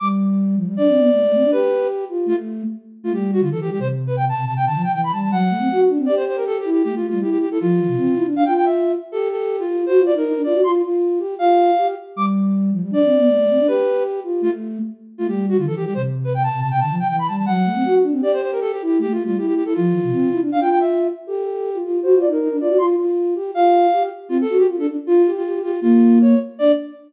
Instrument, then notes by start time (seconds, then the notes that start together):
flute
0.00 G3 D6
0.56 F3
0.66 G3
0.77 D4 D5
0.88 C4
0.99 B3
1.14 A3
1.24 A3
1.35 C4
1.44 D4
1.52 G4 B4
2.09 F4
2.26 A3 F4
3.03 A3 F4
3.13 G3 G4
3.33 F#4
3.41 D3 F4
3.52 E3 A4
3.61 E3 G4
3.70 G3 G4
3.79 C3 C5
4.07 B4
4.17 G5
4.29 A5
4.37 C3
4.46 C3 A5
4.56 C3 G5
4.66 D3 A5
4.75 F3
4.84 G5
4.93 E3 G5
5.04 B5
5.13 G3 A5
5.23 A5
5.30 F#3 F#5
5.50 A3
5.59 C4
5.72 F#4
5.89 D4
5.98 C4
6.06 G4 D5
6.16 C5
6.27 C5
6.37 A#4
6.47 A4
6.59 G4
6.65 E4
6.72 G4
6.83 A3 G4
6.94 A3 F4
7.09 G3 F4
7.20 E4 G4
7.31 G4
7.41 G4
7.50 E4 A4
7.60 F3 F4
7.79 E3
7.88 C3
7.97 C4
8.15 E4
8.25 D4
8.36 D4 F5
8.45 F4 G5
8.56 G5
8.65 E5
9.12 G4 A4
9.31 A4
9.59 F4
9.68 F4
9.86 F#4 C5
9.99 F4
10.06 D5
10.14 D#4 A#4
10.25 D#4
10.36 D4
10.43 F4 D5
10.54 F#4
10.64 F4 C6
10.83 F4
11.19 G4
11.39 F4 F5
11.78 G4
12.16 G3 D6
12.72 F3
12.82 G3
12.91 D4 D5
13.05 C4
13.18 B3
13.29 A3
13.38 A3
13.50 C4
13.59 D4
13.67 G4 B4
14.24 F4
14.41 A3 F4
15.18 A3 F4
15.28 G3 G4
15.49 F#4
15.58 D3 F4
15.67 E3 A4
15.76 E3 G4
15.85 G3 G4
15.94 C3 C5
16.24 B4
16.34 G5
16.43 A5
16.54 C3
16.61 C3 A5
16.71 C3 G5
16.80 D3 A5
16.90 F3
16.99 G5
17.09 E3 G5
17.19 B5
17.28 G3 A5
17.37 A5
17.46 F#3 F#5
17.66 A3
17.75 C4
17.85 F#4
18.03 D4
18.12 C4
18.21 G4 D5
18.33 C5
18.42 C5
18.52 A#4
18.61 A4
18.71 G4
18.82 E4 G4
18.99 A3 G4
19.09 A3 F4
19.25 G3 F4
19.38 E4 G4
19.47 G4
19.56 G4
19.65 E4 A4
19.74 F3 F4
19.92 E3
20.03 C3
20.12 C4
20.32 E4
20.41 D4
20.52 D4 F5
20.61 F4 G5
20.70 G5
20.80 E5
21.27 G4 A4
21.44 A4
21.74 F4
21.83 F4
22.03 F#4 C5
22.15 F4
22.21 D5
22.27 D#4
22.32 A#4
22.40 D#4
22.51 D4
22.60 F4 D5
22.69 F#4
22.78 F4 C6
22.98 F4
23.35 G4
23.55 F4 F5
23.93 G4
24.29 C4 F4
24.41 A4
24.49 F#4
24.58 G4
24.68 F4
24.78 D4 A4
24.88 D4
25.07 F4
25.26 G4
25.36 F4
25.45 G4
25.54 G4
25.63 F4 G4
25.81 A#3 F4
26.21 C#5
26.59 D4 D5